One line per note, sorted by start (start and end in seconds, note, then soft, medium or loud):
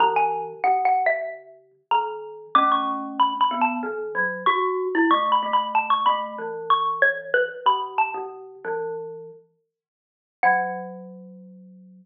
0.00 0.53 C#3 medium
0.00 0.53 E3 medium
0.00 0.15 A#5 loud
0.16 0.44 G#5 loud
0.64 1.72 C#3 medium
0.64 0.84 F#5 medium
0.85 1.05 F#5 loud
1.06 1.27 E5 loud
1.91 2.46 D#3 medium
1.91 2.49 A#5 medium
2.55 3.33 A3 medium
2.55 3.33 C#4 medium
2.55 2.70 D6 loud
2.72 3.00 C#6 medium
3.20 3.40 B5 medium
3.41 3.61 B5 medium
3.51 3.79 B3 medium
3.61 3.82 A5 medium
3.83 4.12 D#3 medium
4.15 4.43 F#3 medium
4.46 4.85 F#4 medium
4.46 5.01 C#6 medium
4.95 5.10 E4 loud
5.11 5.40 A3 loud
5.11 5.31 C#6 loud
5.32 5.52 B5 loud
5.43 6.05 A3 medium
5.53 5.74 B5 medium
5.75 5.90 A5 medium
5.90 6.05 C#6 loud
6.06 6.36 A3 medium
6.06 6.33 B5 loud
6.38 7.49 E3 medium
6.70 7.01 C#6 loud
7.02 7.28 C#5 medium
7.34 7.60 B4 loud
7.66 8.06 C#3 medium
7.66 7.96 B5 loud
7.98 9.71 A5 medium
8.14 8.55 C#3 medium
8.65 9.30 E3 medium
10.43 12.06 F#3 loud
10.43 12.06 F#5 loud